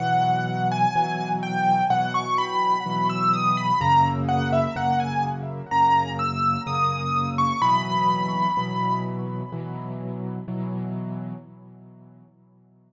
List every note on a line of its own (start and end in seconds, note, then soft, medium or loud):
0.00 0.86 B2 medium
0.00 0.86 E3 medium
0.00 0.86 F#3 medium
0.00 0.68 F#5 medium
0.71 1.29 G#5 medium
0.96 1.81 B2 medium
0.96 1.81 E3 medium
0.96 1.81 F#3 medium
1.43 1.83 G5 medium
1.90 2.76 B2 medium
1.90 2.76 E3 medium
1.90 2.76 F#3 medium
1.90 2.13 F#5 medium
2.14 2.37 C#6 medium
2.38 3.08 B5 medium
2.86 3.71 B2 medium
2.86 3.71 E3 medium
2.86 3.71 F#3 medium
3.10 3.32 E6 medium
3.33 3.56 D#6 medium
3.57 3.80 B5 medium
3.81 4.66 F#2 loud
3.81 4.66 C#3 loud
3.81 4.66 A#3 medium
3.81 4.04 A#5 medium
4.29 4.51 F#5 medium
4.53 4.75 E5 medium
4.76 5.62 F#2 medium
4.76 5.62 C#3 medium
4.76 5.62 A#3 medium
4.76 4.99 F#5 medium
5.00 5.22 G#5 medium
5.71 6.57 F#2 medium
5.71 6.57 C#3 medium
5.71 6.57 A#3 medium
5.71 6.11 A#5 medium
6.19 6.62 E6 medium
6.66 7.52 F#2 medium
6.66 7.52 C#3 medium
6.66 7.52 A#3 medium
6.66 7.27 D#6 medium
7.38 7.61 C#6 medium
7.62 8.47 B2 medium
7.62 8.47 E3 loud
7.62 8.47 F#3 medium
7.62 8.98 B5 medium
8.57 9.43 B2 medium
8.57 9.43 E3 medium
8.57 9.43 F#3 medium
9.52 10.38 B2 medium
9.52 10.38 E3 medium
9.52 10.38 F#3 medium
10.48 11.34 B2 medium
10.48 11.34 E3 medium
10.48 11.34 F#3 medium